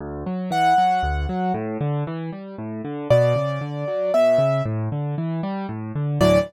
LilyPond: <<
  \new Staff \with { instrumentName = "Acoustic Grand Piano" } { \time 3/4 \key d \major \tempo 4 = 116 r4 fis''2 | r2. | d''2 e''4 | r2. |
d''4 r2 | }
  \new Staff \with { instrumentName = "Acoustic Grand Piano" } { \clef bass \time 3/4 \key d \major d,8 fis8 e8 fis8 d,8 fis8 | a,8 d8 e8 g8 a,8 d8 | b,8 cis8 d8 fis8 b,8 cis8 | a,8 d8 e8 g8 a,8 d8 |
<d, a, e fis>4 r2 | }
>>